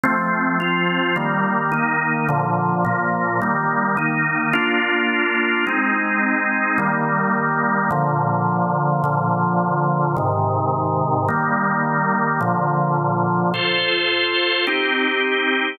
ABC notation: X:1
M:3/4
L:1/8
Q:1/4=160
K:Fmix
V:1 name="Drawbar Organ"
[F,A,C]3 [F,CF]3 | [E,G,B,]3 [E,B,E]3 | [B,,D,F,]3 [B,,F,B,]3 | [E,G,B,]3 [E,B,E]3 |
[K:Bbmix] [B,DF]6 | [A,CE]6 | [E,G,B,]6 | [B,,D,F,]6 |
[B,,D,F,]6 | [A,,C,E,]6 | [E,G,B,]6 | [B,,D,F,]6 |
[K:Fmix] [FAc]6 | [CEG]6 |]